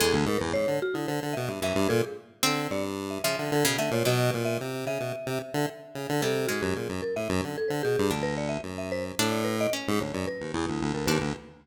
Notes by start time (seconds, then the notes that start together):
0.00 E2 G#3 A4
0.13 D2
0.26 G#2 A#4
0.38 E2 B4
0.53 G#2 C#5
0.68 D3
0.82 F#4
0.94 D3 E4
1.07 D3 C5
1.23 D3
1.33 B2 E5
1.48 G2 E5
1.61 F#2 E3 E5
1.75 G2
1.89 A#2 A4
2.03 G#4
2.43 D3 C4
2.70 G2 D5
3.10 E5
3.24 C#3 F3 E5
3.39 D3 E5
3.52 D3 A4
3.65 B2 C#3
3.78 D3 A3 E5
3.91 A#2 C#5
4.05 B2 F#3 D#5
4.34 A#2
4.45 E5
4.61 C3
4.86 C#3 E5
5.00 B2
5.26 C3
5.54 D3
5.95 C#3
6.09 D3
6.22 C3 G3 A4
6.47 G#2 G#3 F#4
6.62 F#2 G4
6.76 A#2 G#4
6.89 F#2
7.02 A#4
7.16 A2 E5
7.29 F#2
7.44 D3
7.58 A4
7.68 D3 C5
7.83 B2 G#4
7.99 G2
8.10 D2 D4
8.23 B4
8.38 D5
8.49 E5
8.63 F#2
8.78 E5
8.92 C5
9.18 A2 D4
9.32 D5
9.44 B4
9.61 D#5
9.73 C#4
9.88 G#2
10.00 D2 C#5
10.14 F#2 D5
10.27 B4
10.40 D#2
10.53 E2 E4
10.68 D2
10.81 D2
10.94 D2 A#4
11.06 D#2 D4 B4
11.21 D2